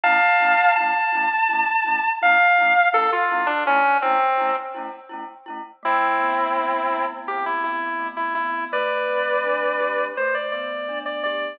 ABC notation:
X:1
M:4/4
L:1/16
Q:1/4=83
K:Ddor
V:1 name="Distortion Guitar"
[fa]4 a8 f4 | A F2 D ^C2 =C3 z7 | [K:Ador] [CE]8 G E E3 E E2 | [Bd]8 c d d3 d d2 |]
V:2 name="Glockenspiel"
[A,^CE]2 [A,CE]2 [A,CE]2 [A,CE]2 [A,CE]2 [A,CE]2 [A,CE]2 [A,CE]2 | [A,^CE]2 [A,CE]2 [A,CE]2 [A,CE]2 [A,CE]2 [A,CE]2 [A,CE]2 [A,CE]2 | [K:Ador] A,2 B,2 C2 E2 C2 B,2 A,2 B,2 | A,2 C2 D2 G2 A,2 B,2 D2 G2 |]